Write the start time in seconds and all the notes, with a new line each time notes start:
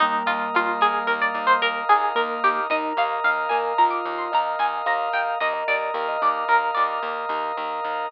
0.00 D#2 G3 A#3 D#4 A#4
0.26 D#2 F4 D#5
0.54 D#2 F4 F5
0.81 D#2 G#4 D#5
1.07 D#2 A#4
1.22 D5
1.34 D#2 D#5
1.47 C5
1.62 D#2 A#4 F5
1.89 D#2 G#4 D#5
2.15 D#2 A#3 A#4
2.43 D#2 G4 D#5
2.70 D#2 D#4 A#4 D#5
2.97 D#2 D#5 F5
3.24 D#2 D#5 F5
3.49 D#2 A#4 D#5 G#5
3.78 D#2 F4 A#4 A#5
3.91 D6
4.05 D#2 D#5
4.18 C6
4.32 D#2 D#5 F5 A#5
4.59 D#2 D#5 G#5
4.86 D#2 A#4 F5 A#5
5.13 D#2 D#5 F5 G5
5.40 D#2 A#4 D#5
5.53 D#5
5.68 D#2 D5 D#5
5.94 D#2 A#4 F5
6.08 D#5
6.22 D#2 D5 D#5
6.48 D#2 A#4
6.75 D#2 D5 D#5
7.03 D#2 F5
7.29 D#2 D#5
7.57 D#2 A#4
7.83 D#2 D#5